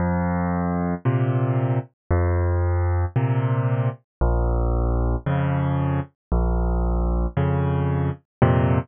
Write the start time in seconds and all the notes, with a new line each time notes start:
0.00 F2
1.05 A#2 C3
2.11 F2
3.16 A#2 C3
4.21 A#1
5.26 F2 C#3
6.32 A#1
7.37 F2 C#3
8.42 F2 A#2 C3